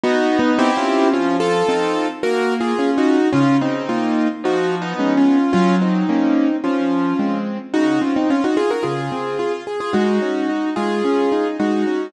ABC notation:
X:1
M:4/4
L:1/16
Q:1/4=109
K:Bbm
V:1 name="Acoustic Grand Piano"
(3[EG]4 [_CE]4 [DF]4 | [DF]2 [F=A]6 (3[GB]4 [F_A]4 [EG]4 | [DF]2 [CE]6 (3[EG]4 [_CE]4 [DF]4 | [DF]2 [CE]6 [DF]6 z2 |
[K:Db] [EG]2 [DF] [CE] [DF] [EG] [FA] [GB] [FA]6 z [FA] | [EG]6 [FA]6 [EG]4 |]
V:2 name="Acoustic Grand Piano"
[_CE]4 [=C=E=G]4 | F,4 [CE=A]4 B,4 [DF]4 | D,4 [B,F]4 F,4 [A,_CD]4 | G,4 [B,D]4 F,4 [A,C]4 |
[K:Db] D,2 C2 z4 D,2 C2 F2 A2 | A,2 D2 E2 A,2 D2 E2 A,2 D2 |]